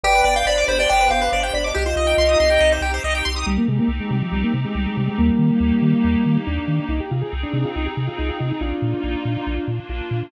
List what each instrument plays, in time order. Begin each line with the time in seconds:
0.03 synth bass 1 G1, pad 5 (bowed) B3 D4 G4, lead 1 (square) G4 B4 D5 G5
0.15 lead 1 (square) B4
0.24 synth bass 1 G1, lead 1 (square) D5 G5
0.36 lead 1 (square) F5 G5
0.46 synth bass 1 G1, lead 1 (square) C5 D5 B5
0.58 lead 1 (square) D6
0.68 synth bass 1 G1, lead 1 (square) C5 B5
0.79 lead 1 (square) D5 G5
0.89 synth bass 1 G1, lead 1 (square) D5 G5
1.00 lead 1 (square) B4
1.11 synth bass 1 G1, lead 1 (square) G4 F5
1.21 lead 1 (square) B4
1.32 synth bass 1 G1, lead 1 (square) C5 D5
1.43 lead 1 (square) G5
1.54 synth bass 1 G1, lead 1 (square) D5 B5
1.64 lead 1 (square) D#5 D6
1.74 synth bass 1 C2, pad 5 (bowed) C4 D#4 G4, lead 1 (square) G4 D#5
1.86 lead 1 (square) F4 C5
1.96 synth bass 1 C2, lead 1 (square) D#5
2.07 lead 1 (square) G5
2.18 synth bass 1 C2, lead 1 (square) C6
2.29 lead 1 (square) D#6
2.40 synth bass 1 C2, lead 1 (square) C6
2.50 lead 1 (square) G5
2.60 synth bass 1 C2, lead 1 (square) D#5
2.72 lead 1 (square) C5
2.81 synth bass 1 C2, lead 1 (square) G4
2.94 lead 1 (square) C5
3.04 synth bass 1 C2, lead 1 (square) D#5
3.15 lead 1 (square) G5
3.25 synth bass 1 C2, lead 1 (square) C6
3.36 lead 1 (square) D#6
3.46 synth bass 1 C2, lead 1 (square) G3, pad 5 (bowed) C4 D#4 G4
3.57 lead 1 (square) A#3
3.68 synth bass 1 C3, lead 1 (square) G#3
3.79 lead 1 (square) A#3
3.88 synth bass 1 C2
4.00 lead 1 (square) G#3
4.11 synth bass 1 C3, lead 1 (square) G3
4.22 lead 1 (square) F3
4.32 synth bass 1 C2, lead 1 (square) G3
4.43 lead 1 (square) A#3
4.54 synth bass 1 C3
4.64 lead 1 (square) G#3
4.75 synth bass 1 C2, lead 1 (square) G3
4.86 lead 1 (square) G#3
4.97 synth bass 1 C3, lead 1 (square) G3
5.07 lead 1 (square) G#3
5.18 synth bass 1 D#2, lead 1 (square) G3 A#3, pad 5 (bowed) A#3 D#4 G4
5.39 synth bass 1 D#3
5.60 synth bass 1 D#2
5.82 synth bass 1 D#3
6.04 synth bass 1 D#2
6.26 synth bass 1 D#3
6.47 synth bass 1 D#2, lead 1 (square) D4
6.68 synth bass 1 D#3
6.89 synth bass 1 C2, pad 5 (bowed) C4 D#4 G#4, lead 1 (square) D#4
7.00 lead 1 (square) G4
7.11 synth bass 1 C3, lead 1 (square) F4
7.22 lead 1 (square) G#4
7.33 synth bass 1 C2
7.43 lead 1 (square) D4
7.53 synth bass 1 C3, lead 1 (square) D4
7.65 lead 1 (square) F4
7.75 synth bass 1 C2, lead 1 (square) D#4
7.86 lead 1 (square) G4
7.97 synth bass 1 C3
8.07 lead 1 (square) F4
8.18 synth bass 1 C2, lead 1 (square) D#4
8.29 lead 1 (square) F4
8.39 synth bass 1 C3, lead 1 (square) D#4
8.50 lead 1 (square) D#4
8.60 synth bass 1 A#1, pad 5 (bowed) A#3 D#4 F4, lead 1 (square) D4 F4
8.82 synth bass 1 A#2
9.04 synth bass 1 A#1
9.25 synth bass 1 A#2
9.47 synth bass 1 A#1, pad 5 (bowed) A#3 D4 F4
9.68 synth bass 1 A#2
9.89 synth bass 1 A#1, lead 1 (square) F4
10.11 synth bass 1 A#2